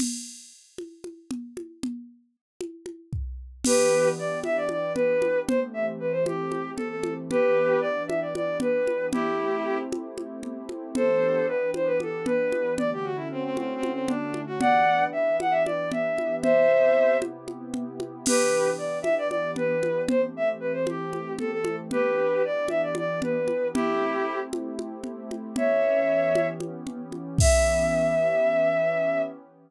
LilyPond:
<<
  \new Staff \with { instrumentName = "Violin" } { \time 7/8 \key e \minor \tempo 4 = 115 r2. r8 | r2. r8 | <g' b'>4 d''8 e''16 d''16 d''8 b'4 | c''16 r16 e''16 r16 b'16 c''16 g'4 a'16 a'8 r16 |
<g' b'>4 d''8 e''16 d''16 d''8 b'4 | <e' g'>4. r2 | <a' c''>4 b'8 c''16 b'16 a'8 b'4 | d''16 g'16 fis'16 e'16 c'16 c'16 \tuplet 3/2 { c'8 c'8 c'8 } d'8. fis'16 |
<d'' fis''>4 e''8 fis''16 e''16 d''8 e''4 | <c'' e''>4. r2 | <g' b'>4 d''8 e''16 d''16 d''8 b'4 | c''16 r16 e''16 r16 b'16 c''16 g'4 a'16 a'8 r16 |
<g' b'>4 d''8 e''16 d''16 d''8 b'4 | <e' g'>4. r2 | <cis'' e''>2 r4. | e''2.~ e''8 | }
  \new Staff \with { instrumentName = "Pad 2 (warm)" } { \time 7/8 \key e \minor r2. r8 | r2. r8 | <e b d' g'>2.~ <e b d' g'>8 | <e a c' g'>2.~ <e a c' g'>8 |
<e b d' g'>2.~ <e b d' g'>8 | <a c' e' g'>2.~ <a c' e' g'>8 | <e b d' g'>2.~ <e b d' g'>8 | <d a cis' fis'>2.~ <d a cis' fis'>8 |
<e b d' g'>2.~ <e b d' g'>8 | <c b e' g'>2.~ <c b e' g'>8 | <e b d' g'>2.~ <e b d' g'>8 | <e a c' g'>2.~ <e a c' g'>8 |
<e b d' g'>2.~ <e b d' g'>8 | <a c' e' g'>2.~ <a c' e' g'>8 | <e b cis' g'>2.~ <e b cis' g'>8 | <e b cis' g'>2.~ <e b cis' g'>8 | }
  \new DrumStaff \with { instrumentName = "Drums" } \drummode { \time 7/8 <cgl cymc>4. cgho8 cgho8 cgl8 cgho8 | cgl4. cgho8 cgho8 bd4 | <cgl cymc>4. cgho8 cgho8 cgl8 cgho8 | cgl4. cgho8 cgho8 cgl8 cgho8 |
cgl4. cgho8 cgho8 cgl8 cgho8 | cgl4. cgho8 cgho8 cgl8 cgho8 | cgl4. cgho8 cgho8 cgl8 cgho8 | cgl4. cgho8 cgho8 cgl8 cgho8 |
cgl4. cgho8 cgho8 cgl8 cgho8 | cgl4. cgho8 cgho8 cgl8 cgho8 | <cgl cymc>4. cgho8 cgho8 cgl8 cgho8 | cgl4. cgho8 cgho8 cgl8 cgho8 |
cgl4. cgho8 cgho8 cgl8 cgho8 | cgl4. cgho8 cgho8 cgl8 cgho8 | cgl4. cgho8 cgho8 cgl8 cgho8 | <cymc bd>4. r4 r4 | }
>>